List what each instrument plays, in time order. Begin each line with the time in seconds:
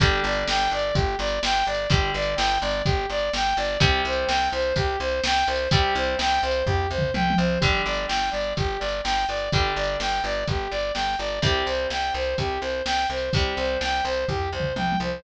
0.00 electric bass (finger) G1, acoustic guitar (steel) D3 G3, lead 2 (sawtooth) G4, kick, closed hi-hat
0.24 electric bass (finger) G1, lead 2 (sawtooth) D5
0.32 closed hi-hat
0.48 electric bass (finger) G1, lead 2 (sawtooth) G5, snare
0.71 electric bass (finger) G1, lead 2 (sawtooth) D5
0.79 closed hi-hat
0.95 electric bass (finger) G1, lead 2 (sawtooth) G4, kick, closed hi-hat
1.19 electric bass (finger) G1, lead 2 (sawtooth) D5
1.27 closed hi-hat
1.43 electric bass (finger) G1, lead 2 (sawtooth) G5, snare
1.67 electric bass (finger) G1, lead 2 (sawtooth) D5
1.75 closed hi-hat
1.90 electric bass (finger) G1, acoustic guitar (steel) D3 G3, lead 2 (sawtooth) G4, kick, closed hi-hat
2.14 electric bass (finger) G1, lead 2 (sawtooth) D5
2.22 closed hi-hat
2.36 electric bass (finger) G1, lead 2 (sawtooth) G5, snare
2.61 electric bass (finger) G1, lead 2 (sawtooth) D5
2.70 closed hi-hat
2.85 electric bass (finger) G1, lead 2 (sawtooth) G4, kick, closed hi-hat
3.10 electric bass (finger) G1, lead 2 (sawtooth) D5
3.18 closed hi-hat
3.33 electric bass (finger) G1, lead 2 (sawtooth) G5, snare
3.57 electric bass (finger) G1, lead 2 (sawtooth) D5
3.65 closed hi-hat
3.80 electric bass (finger) C2, acoustic guitar (steel) C3 G3, lead 2 (sawtooth) G4, kick, closed hi-hat
4.05 electric bass (finger) C2, lead 2 (sawtooth) C5
4.12 closed hi-hat
4.27 electric bass (finger) C2, lead 2 (sawtooth) G5, snare
4.52 electric bass (finger) C2, lead 2 (sawtooth) C5
4.60 closed hi-hat
4.76 electric bass (finger) C2, lead 2 (sawtooth) G4, kick, closed hi-hat
5.00 electric bass (finger) C2, lead 2 (sawtooth) C5
5.08 closed hi-hat
5.24 electric bass (finger) C2, lead 2 (sawtooth) G5, snare
5.47 electric bass (finger) C2, lead 2 (sawtooth) C5
5.56 closed hi-hat
5.71 electric bass (finger) C2, acoustic guitar (steel) C3 G3, lead 2 (sawtooth) G4, kick, closed hi-hat
5.95 electric bass (finger) C2, lead 2 (sawtooth) C5
6.03 closed hi-hat
6.19 electric bass (finger) C2, lead 2 (sawtooth) G5, snare
6.43 electric bass (finger) C2, lead 2 (sawtooth) C5
6.51 closed hi-hat
6.67 electric bass (finger) C2, lead 2 (sawtooth) G4, kick, floor tom
6.90 electric bass (finger) C2, lead 2 (sawtooth) C5
6.98 mid tom
7.14 electric bass (finger) C2, lead 2 (sawtooth) G5, high tom
7.30 high tom
7.37 electric bass (finger) C2, lead 2 (sawtooth) C5
7.60 electric bass (finger) G1, acoustic guitar (steel) D3 G3, lead 2 (sawtooth) G4, kick, closed hi-hat
7.85 electric bass (finger) G1, lead 2 (sawtooth) D5
7.94 closed hi-hat
8.08 electric bass (finger) G1, lead 2 (sawtooth) G5, snare
8.31 electric bass (finger) G1, lead 2 (sawtooth) D5
8.41 closed hi-hat
8.57 electric bass (finger) G1, lead 2 (sawtooth) G4, kick, closed hi-hat
8.79 electric bass (finger) G1, lead 2 (sawtooth) D5
8.88 closed hi-hat
9.04 electric bass (finger) G1, lead 2 (sawtooth) G5, snare
9.29 electric bass (finger) G1, lead 2 (sawtooth) D5
9.37 closed hi-hat
9.52 electric bass (finger) G1, acoustic guitar (steel) D3 G3, lead 2 (sawtooth) G4, kick, closed hi-hat
9.76 electric bass (finger) G1, lead 2 (sawtooth) D5
9.84 closed hi-hat
10.00 electric bass (finger) G1, lead 2 (sawtooth) G5, snare
10.24 electric bass (finger) G1, lead 2 (sawtooth) D5
10.31 closed hi-hat
10.47 electric bass (finger) G1, lead 2 (sawtooth) G4, kick, closed hi-hat
10.71 electric bass (finger) G1, lead 2 (sawtooth) D5
10.80 closed hi-hat
10.94 electric bass (finger) G1, lead 2 (sawtooth) G5, snare
11.19 electric bass (finger) G1, lead 2 (sawtooth) D5
11.27 closed hi-hat
11.42 electric bass (finger) C2, acoustic guitar (steel) C3 G3, lead 2 (sawtooth) G4, kick, closed hi-hat
11.66 electric bass (finger) C2, lead 2 (sawtooth) C5
11.75 closed hi-hat
11.90 electric bass (finger) C2, lead 2 (sawtooth) G5, snare
12.14 electric bass (finger) C2, lead 2 (sawtooth) C5
12.22 closed hi-hat
12.38 electric bass (finger) C2, lead 2 (sawtooth) G4, kick, closed hi-hat
12.61 electric bass (finger) C2, lead 2 (sawtooth) C5
12.70 closed hi-hat
12.86 electric bass (finger) C2, lead 2 (sawtooth) G5, snare
13.10 electric bass (finger) C2, lead 2 (sawtooth) C5
13.18 closed hi-hat
13.33 electric bass (finger) C2, acoustic guitar (steel) C3 G3, lead 2 (sawtooth) G4, kick, closed hi-hat
13.57 electric bass (finger) C2, lead 2 (sawtooth) C5
13.65 closed hi-hat
13.81 electric bass (finger) C2, lead 2 (sawtooth) G5, snare
14.05 electric bass (finger) C2, lead 2 (sawtooth) C5
14.13 closed hi-hat
14.28 electric bass (finger) C2, lead 2 (sawtooth) G4, kick, floor tom
14.52 electric bass (finger) C2, lead 2 (sawtooth) C5
14.60 mid tom
14.76 electric bass (finger) C2, lead 2 (sawtooth) G5, high tom
14.92 high tom
15.00 electric bass (finger) C2, lead 2 (sawtooth) C5